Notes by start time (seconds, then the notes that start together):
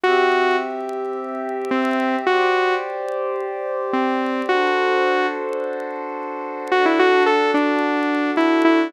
0.04 C4 F#4 G4 E5
1.71 C4
2.27 F#4 G4 C5 D5
3.93 C4
4.49 D4 F#4 A4 C5
6.71 D4 F#4 A4
6.86 E4
6.99 F#4
7.26 A4
7.54 D4
8.37 E4
8.65 E4